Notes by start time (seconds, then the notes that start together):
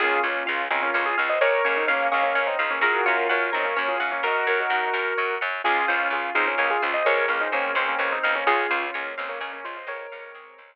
0.00 C#2 A#3 C#4 F4 G#4
0.23 C#2 C#4 F4 C#5
0.46 C#2 C#4 F4 F5
0.70 C#2 C4 C#4 D#4 F4 G#4
0.82 A#3 C#4
0.94 C#2 A#3 C#4 C#5
1.06 F4 G#4
1.18 C#2 C#4 F4 F5
1.29 C5 D#5
1.41 C#2 G#4 A#4 C#5
1.65 C#2 A#3 C#4 C#5
1.77 C4 D#4
1.87 C#2 A#3 C#4 C#5 F5
2.11 C#2 A#3 C#4 G#4 C#5 F5
2.23 A#3 C#4
2.35 C#2 A#3 C#4 C#5
2.47 C4 D#4
2.59 C#2 C4 D#4 F5
2.71 A#3 C#4
2.81 F#2 F4 F#4 G#4 A#4
3.06 F#2 C#4 F4 C#5
3.29 F#2 A#4 C#5 F#5
3.52 F#2 C4 D#4 A#4 C#5
3.65 A#3 C#4
3.77 F#2 A#3 C#4 C#5
3.88 F4 G#4
4.00 F#2 C#4 F4 F#5
4.12 A#3 C#4
4.23 F#2 D#4 F#4 A#4
4.47 F#2 F#4 A#4 C#5
4.60 D#4 F#4
4.70 F#2 D#4 F#4 F#5
4.94 F#2 A#4
5.18 F#2 C#5
5.41 F#2 F#5
5.64 C#2 C#4 F4 G#4
5.88 C#2 C#4 F4 C5
6.10 C#2 F4 G#4 C#5
6.35 C#2 C4 D#4 F4 G#4 F5
6.47 A#3 C#4
6.58 C#2 A#3 C#4 G#4
6.70 F4 G#4
6.82 C#2 C#4 F4 C5
6.94 C5 D#5
7.05 C#2 F3 G#3 A#4 C#5
7.28 C#2 A#3 C#4 F5
7.41 C4 D#4
7.52 C#2 G#3 A#3 C4 C#4 G#4
7.75 C#2 G#3 A#3 C4 C#4 C5
7.88 A#3 C#4
7.99 C#2 A#3 C#4 C#5
8.12 C4 D#4
8.24 C#2 C4 D#4 F5
8.35 A#3 C#4
8.46 C#2 C#4 F4 G#4
8.71 C#2 C#4 F4 C5
8.94 C#2 A#3 C#4 C#5
9.17 C#2 A#3 C4 C#4 D#4 F5
9.29 A#3 C#4
9.40 C#2 A#3 C#4 G#4
9.53 A#3 C#4
9.64 C#2 C#4 F4 C5
9.77 C5 D#5
9.87 C#2 F3 G#3 A#4 C#5
10.12 C#2 G#3 C4 F5
10.34 C#2 G#4
10.58 C#2 C5